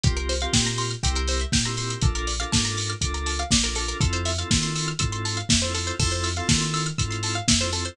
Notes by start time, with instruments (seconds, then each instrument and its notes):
0.04 synth bass 2 C2, drawbar organ C4 F4 G4 A#4, pizzicato strings G4, kick, closed hi-hat
0.17 pizzicato strings A#4, closed hi-hat
0.29 pizzicato strings C5, open hi-hat
0.40 drawbar organ C4 F4 G4 A#4, pizzicato strings F5, closed hi-hat
0.53 synth bass 2 A#2, drawbar organ C4 F4 G4 A#4, pizzicato strings G5, kick, snare
0.65 pizzicato strings A#5, snare, closed hi-hat
0.78 pizzicato strings C6, open hi-hat
0.91 pizzicato strings F6, closed hi-hat
1.03 synth bass 2 C2, drawbar organ C4 E4 G4 A#4, pizzicato strings G4, kick, closed hi-hat
1.15 pizzicato strings A#4, closed hi-hat
1.27 pizzicato strings C5, open hi-hat
1.39 pizzicato strings E5, closed hi-hat
1.52 synth bass 2 A#2, pizzicato strings G5, kick, snare
1.65 drawbar organ C4 E4 G4 A#4, pizzicato strings A#5, closed hi-hat
1.77 drawbar organ C4 E4 G4 A#4, pizzicato strings C6, open hi-hat
1.90 pizzicato strings E6, closed hi-hat
2.01 synth bass 2 A#1, drawbar organ D4 F4 A4 A#4, pizzicato strings A4, kick, closed hi-hat
2.15 pizzicato strings A#4, closed hi-hat
2.27 pizzicato strings D5, open hi-hat
2.40 drawbar organ D4 F4 A4 A#4, pizzicato strings F5, closed hi-hat
2.52 synth bass 2 G#2, drawbar organ D4 F4 A4 A#4, pizzicato strings A5, kick, snare
2.65 pizzicato strings A#5, snare, closed hi-hat
2.77 pizzicato strings D6, open hi-hat
2.90 pizzicato strings F6, closed hi-hat
3.01 synth bass 2 C#2, drawbar organ D4 F4 A4 A#4, pizzicato strings D6, kick, closed hi-hat
3.14 pizzicato strings A#5, closed hi-hat
3.26 pizzicato strings A5, open hi-hat
3.39 pizzicato strings F5, closed hi-hat
3.51 synth bass 2 A#1, pizzicato strings D5, kick, snare
3.64 drawbar organ D4 F4 A4 A#4, pizzicato strings A#4, closed hi-hat
3.75 drawbar organ D4 F4 A4 A#4, pizzicato strings A4, open hi-hat
3.88 pizzicato strings A#4, closed hi-hat
4.01 synth bass 2 F2, drawbar organ C4 E4 F4 A4, pizzicato strings A4, kick, closed hi-hat
4.13 pizzicato strings C5, closed hi-hat
4.25 pizzicato strings E5, open hi-hat
4.38 drawbar organ C4 E4 F4 A4, pizzicato strings F5, closed hi-hat
4.51 synth bass 2 D#3, drawbar organ C4 E4 F4 A4, pizzicato strings A5, kick, snare
4.63 pizzicato strings C6, snare, closed hi-hat
4.76 pizzicato strings E6, open hi-hat
4.88 pizzicato strings F6, closed hi-hat
4.99 synth bass 2 G#2, drawbar organ C4 E4 F4 A4, pizzicato strings E6, kick, closed hi-hat
5.12 pizzicato strings C6, closed hi-hat
5.25 pizzicato strings A5, open hi-hat
5.37 pizzicato strings F5, closed hi-hat
5.49 synth bass 2 F2, pizzicato strings E5, kick, snare
5.62 drawbar organ C4 E4 F4 A4, pizzicato strings C5, closed hi-hat
5.74 drawbar organ C4 E4 F4 A4, pizzicato strings A4, open hi-hat
5.87 pizzicato strings C5, closed hi-hat
5.99 synth bass 2 F2, drawbar organ C4 E4 F4 A4, pizzicato strings A4, kick, crash
6.11 pizzicato strings C5, closed hi-hat
6.24 pizzicato strings E5, open hi-hat
6.36 drawbar organ C4 E4 F4 A4, pizzicato strings F5, closed hi-hat
6.48 synth bass 2 D#3, drawbar organ C4 E4 F4 A4, pizzicato strings A5, kick, snare
6.60 pizzicato strings C6, snare, closed hi-hat
6.74 pizzicato strings E6, open hi-hat
6.86 pizzicato strings F6, closed hi-hat
6.98 synth bass 2 G#2, drawbar organ C4 E4 F4 A4, pizzicato strings E6, kick, closed hi-hat
7.11 pizzicato strings C6, closed hi-hat
7.23 pizzicato strings A5, open hi-hat
7.35 pizzicato strings F5, closed hi-hat
7.48 synth bass 2 F2, pizzicato strings E5, kick, snare
7.60 drawbar organ C4 E4 F4 A4, pizzicato strings C5, closed hi-hat
7.72 drawbar organ C4 E4 F4 A4, pizzicato strings A4, open hi-hat
7.85 pizzicato strings C5, closed hi-hat